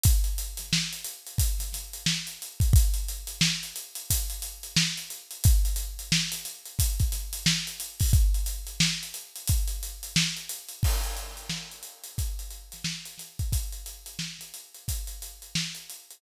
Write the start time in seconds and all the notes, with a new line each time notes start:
0.04 kick, closed hi-hat
0.24 closed hi-hat
0.38 closed hi-hat
0.57 snare, closed hi-hat
0.73 snare
0.93 closed hi-hat
1.04 closed hi-hat
1.27 closed hi-hat
1.38 kick, closed hi-hat
1.59 snare, closed hi-hat
1.73 snare, closed hi-hat
1.93 closed hi-hat
2.06 snare
2.27 closed hi-hat
2.42 closed hi-hat
2.60 kick, closed hi-hat
2.73 kick, closed hi-hat
2.94 closed hi-hat
3.08 closed hi-hat
3.27 closed hi-hat
3.41 snare
3.63 closed hi-hat
3.76 closed hi-hat
3.95 closed hi-hat
4.10 kick, closed hi-hat
4.30 closed hi-hat
4.42 closed hi-hat
4.63 closed hi-hat
4.76 snare
4.97 closed hi-hat
5.10 closed hi-hat
5.31 closed hi-hat
5.44 kick, closed hi-hat
5.65 closed hi-hat
5.76 closed hi-hat
5.99 closed hi-hat
6.12 snare
6.32 snare, closed hi-hat
6.45 closed hi-hat
6.65 closed hi-hat
6.79 kick, closed hi-hat
7.00 kick, closed hi-hat
7.12 snare, closed hi-hat
7.33 closed hi-hat
7.46 snare
7.67 closed hi-hat
7.80 closed hi-hat
8.00 kick, open hi-hat
8.13 kick, closed hi-hat
8.34 closed hi-hat
8.46 closed hi-hat
8.67 closed hi-hat
8.80 snare
9.03 closed hi-hat
9.14 closed hi-hat
9.36 closed hi-hat
9.47 kick, closed hi-hat
9.68 closed hi-hat
9.83 closed hi-hat
10.03 closed hi-hat
10.16 snare
10.37 closed hi-hat
10.49 closed hi-hat
10.69 closed hi-hat
10.83 kick, crash
11.04 closed hi-hat
11.17 closed hi-hat
11.37 closed hi-hat
11.49 snare
11.71 closed hi-hat
11.83 closed hi-hat
12.04 closed hi-hat
12.18 kick, closed hi-hat
12.39 closed hi-hat
12.51 closed hi-hat
12.72 snare, closed hi-hat
12.84 snare
13.05 closed hi-hat
13.18 snare, closed hi-hat
13.39 kick, closed hi-hat
13.52 kick, closed hi-hat
13.72 closed hi-hat
13.86 closed hi-hat
14.06 closed hi-hat
14.19 snare
14.39 snare, closed hi-hat
14.54 closed hi-hat
14.74 closed hi-hat
14.88 kick, closed hi-hat
15.07 closed hi-hat
15.22 closed hi-hat
15.42 closed hi-hat
15.55 snare
15.75 closed hi-hat
15.90 closed hi-hat
16.11 closed hi-hat